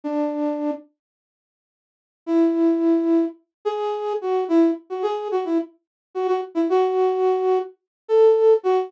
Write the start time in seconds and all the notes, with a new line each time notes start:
0.04 D4
2.26 E4
3.65 G#4
4.21 F#4
4.48 E4
4.90 F#4
5.02 G#4
5.31 F#4
5.45 E4
6.14 F#4
6.28 F#4
6.55 E4
6.69 F#4
8.08 A4
8.63 F#4